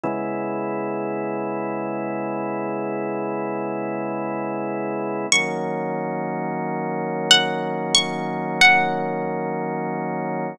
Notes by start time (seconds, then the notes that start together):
0.03 C#3 G#3 B3 E4
5.32 D#3 F#3 A#3 C#4 C#6
7.31 F#5
7.95 C#6
8.61 F#5